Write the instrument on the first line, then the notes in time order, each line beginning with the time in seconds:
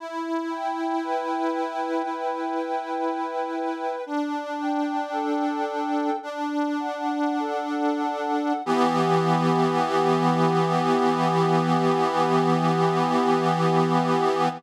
accordion
0.00 E4
0.50 G5
1.03 B4
1.52 G5
2.03 E4
2.54 G5
3.05 G5
3.56 B4
4.06 D4
4.58 G5
5.12 A4
5.65 G5
6.23 D4
6.80 F#5
7.39 A4
8.02 F#5
8.66 E3 B3 G4